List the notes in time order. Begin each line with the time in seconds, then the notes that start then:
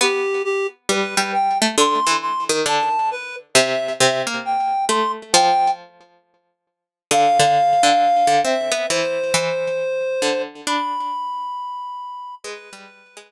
0.01 B3 G4
0.44 G4
0.89 G3 B4
1.17 G3
1.33 G5
1.62 A3
1.78 D3 C6
2.07 E3
2.22 C6
2.49 D#3
2.66 D3 A5
3.11 B4
3.54 C3 E5
4.00 C3 E5
4.27 A#3
4.45 G5
4.89 A3 C6
5.33 F3 G5
7.11 D3 F5
7.39 D3
7.83 D3
8.27 D3
8.44 C4 E5
8.72 B3
8.89 E3 C5
9.34 E3
10.22 D3
10.67 D4 B5
12.44 G#3 B4
12.73 G3
13.17 G#3